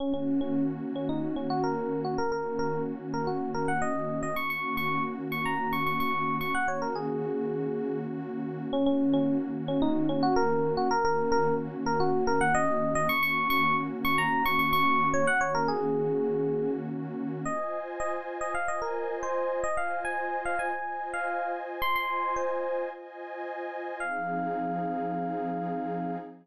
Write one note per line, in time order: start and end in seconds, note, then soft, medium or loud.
0.00 2.16 D#3 medium
0.00 2.16 A#3 medium
0.00 0.13 C#4 loud
0.00 2.16 C#4 medium
0.00 2.16 F#4 medium
0.14 0.40 C#4 medium
0.41 0.64 C#4 medium
0.96 1.09 C#4 medium
1.09 1.35 D#4 medium
1.36 1.49 C#4 medium
1.50 1.63 F#4 loud
1.64 2.00 A#4 loud
2.05 2.18 F#4 medium
2.18 4.34 D#3 medium
2.18 4.34 A#3 medium
2.18 4.34 C#4 medium
2.18 4.34 F#4 medium
2.18 2.31 A#4 loud
2.32 2.58 A#4 medium
2.59 2.82 A#4 loud
3.14 3.27 A#4 medium
3.27 3.51 F#4 medium
3.54 3.67 A#4 loud
3.68 3.81 F#5 medium
3.82 4.20 D#5 loud
4.23 4.36 D#5 loud
4.36 6.52 D#3 medium
4.36 6.52 A#3 medium
4.36 6.52 C#4 medium
4.36 6.52 F#4 medium
4.36 4.49 C#6 loud
4.50 4.75 C#6 medium
4.77 5.03 C#6 loud
5.32 5.45 C#6 loud
5.45 5.71 A#5 medium
5.73 5.86 C#6 loud
5.86 5.99 C#6 medium
6.00 6.36 C#6 loud
6.41 6.54 C#6 loud
6.55 8.71 D#3 medium
6.55 8.71 A#3 medium
6.55 8.71 C#4 medium
6.55 8.71 F#4 loud
6.55 6.68 F#5 loud
6.68 6.81 C#5 medium
6.82 6.95 A#4 loud
6.95 7.98 G#4 medium
8.73 10.89 D#3 medium
8.73 10.89 A#3 medium
8.73 10.89 C#4 medium
8.73 8.86 C#4 loud
8.73 10.89 F#4 medium
8.86 9.13 C#4 loud
9.14 9.37 C#4 loud
9.68 9.81 C#4 loud
9.82 10.08 D#4 loud
10.09 10.22 C#4 loud
10.23 10.36 F#4 loud
10.36 10.73 A#4 loud
10.77 10.90 F#4 loud
10.91 13.08 D#3 medium
10.91 13.08 A#3 medium
10.91 13.08 C#4 medium
10.91 13.08 F#4 medium
10.91 11.04 A#4 loud
11.05 11.31 A#4 loud
11.32 11.55 A#4 loud
11.86 11.99 A#4 loud
12.00 12.24 F#4 loud
12.27 12.40 A#4 loud
12.41 12.54 F#5 loud
12.55 12.93 D#5 loud
12.95 13.08 D#5 loud
13.09 15.25 D#3 medium
13.09 15.25 A#3 medium
13.09 15.25 C#4 medium
13.09 15.25 F#4 medium
13.09 13.22 C#6 loud
13.23 13.48 C#6 loud
13.50 13.76 C#6 loud
14.05 14.18 C#6 loud
14.18 14.44 A#5 loud
14.46 14.59 C#6 loud
14.59 14.72 C#6 loud
14.73 15.08 C#6 loud
15.14 15.27 C#5 loud
15.27 17.44 D#3 medium
15.27 17.44 A#3 medium
15.27 17.44 C#4 medium
15.27 17.44 F#4 medium
15.27 15.40 F#5 loud
15.41 15.54 C#5 loud
15.55 15.68 A#4 loud
15.68 16.71 G#4 loud
17.45 18.53 F4 medium
17.45 18.53 C5 medium
17.45 18.53 D#5 medium
17.45 17.79 D#5 loud
17.45 18.53 G#5 medium
18.00 18.13 D#5 loud
18.41 18.54 D#5 loud
18.54 19.62 F4 medium
18.54 19.62 C5 medium
18.54 19.62 D#5 medium
18.54 18.68 F5 loud
18.54 19.62 G#5 medium
18.68 18.81 D#5 loud
18.82 19.15 A#4 medium
19.23 19.60 C5 loud
19.64 20.72 F4 medium
19.64 20.72 C5 medium
19.64 19.77 D#5 loud
19.64 20.72 D#5 medium
19.64 20.72 G#5 medium
19.77 20.00 F5 medium
20.05 20.41 G#5 loud
20.45 20.58 F5 loud
20.59 21.08 G#5 medium
20.73 21.81 F4 medium
20.73 21.81 C5 medium
20.73 21.81 D#5 medium
20.73 21.81 G#5 medium
21.14 21.52 F5 loud
21.81 22.89 F4 medium
21.81 22.89 C5 medium
21.81 22.89 D#5 medium
21.81 22.89 G#5 medium
21.81 21.95 C6 loud
21.96 22.35 C6 loud
22.36 22.82 C5 medium
22.91 23.99 F4 medium
22.91 23.99 C5 medium
22.91 23.99 D#5 medium
22.91 23.99 G#5 medium
24.00 26.17 F3 medium
24.00 26.17 C4 loud
24.00 26.17 D#4 loud
24.00 26.17 G#4 medium
24.00 26.16 F5 loud